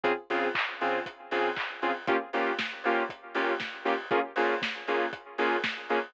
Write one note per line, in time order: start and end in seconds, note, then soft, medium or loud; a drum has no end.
0.04 0.13 C#3 medium
0.04 0.13 C4 medium
0.04 0.13 F4 medium
0.04 0.13 G#4 medium
0.04 kick medium
0.04 closed hi-hat loud
0.30 0.48 C#3 medium
0.30 0.48 C4 medium
0.30 0.48 F4 medium
0.30 0.48 G#4 medium
0.30 open hi-hat medium
0.55 kick medium
0.55 clap loud
0.81 0.99 C#3 medium
0.81 0.99 C4 medium
0.81 0.99 F4 medium
0.81 0.99 G#4 medium
0.81 open hi-hat medium
1.06 kick medium
1.06 closed hi-hat loud
1.31 1.50 C#3 medium
1.31 1.50 C4 medium
1.31 1.50 F4 medium
1.31 1.50 G#4 medium
1.31 open hi-hat medium
1.57 kick medium
1.57 clap loud
1.82 1.91 C#3 medium
1.82 1.91 C4 medium
1.82 1.91 F4 medium
1.82 1.91 G#4 medium
1.82 open hi-hat medium
2.07 2.17 A#3 medium
2.07 2.17 C#4 medium
2.07 2.17 F4 medium
2.07 2.17 G4 medium
2.07 kick loud
2.07 closed hi-hat loud
2.33 2.51 A#3 medium
2.33 2.51 C#4 medium
2.33 2.51 F4 medium
2.33 2.51 G4 medium
2.33 open hi-hat medium
2.59 kick medium
2.59 snare loud
2.84 3.03 A#3 medium
2.84 3.03 C#4 medium
2.84 3.03 F4 medium
2.84 3.03 G4 medium
2.84 open hi-hat medium
3.09 kick medium
3.09 closed hi-hat medium
3.35 3.53 A#3 medium
3.35 3.53 C#4 medium
3.35 3.53 F4 medium
3.35 3.53 G4 medium
3.35 open hi-hat medium
3.60 kick medium
3.60 snare medium
3.85 3.94 A#3 medium
3.85 3.94 C#4 medium
3.85 3.94 F4 medium
3.85 3.94 G4 medium
3.85 open hi-hat medium
4.11 4.20 A#3 medium
4.11 4.20 C#4 medium
4.11 4.20 F4 medium
4.11 4.20 G#4 medium
4.11 kick loud
4.11 closed hi-hat medium
4.36 4.55 A#3 medium
4.36 4.55 C#4 medium
4.36 4.55 F4 medium
4.36 4.55 G#4 medium
4.36 open hi-hat medium
4.62 kick medium
4.62 snare loud
4.88 5.06 A#3 medium
4.88 5.06 C#4 medium
4.88 5.06 F4 medium
4.88 5.06 G#4 medium
4.88 open hi-hat medium
5.13 kick medium
5.13 closed hi-hat loud
5.38 5.56 A#3 medium
5.38 5.56 C#4 medium
5.38 5.56 F4 medium
5.38 5.56 G#4 medium
5.38 open hi-hat medium
5.64 kick medium
5.64 snare loud
5.89 5.99 A#3 medium
5.89 5.99 C#4 medium
5.89 5.99 F4 medium
5.89 5.99 G#4 medium
5.89 open hi-hat medium